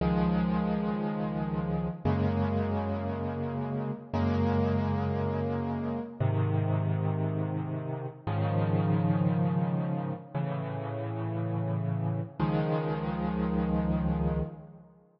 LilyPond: \new Staff { \time 6/8 \key des \major \tempo 4. = 58 <des, ees f aes>2. | <ges, des aes bes>2. | <ges, des aes bes>2. | <aes, c ees>2. |
<aes, des ees f>2. | <a, cis e>2. | <des, ees f aes>2. | }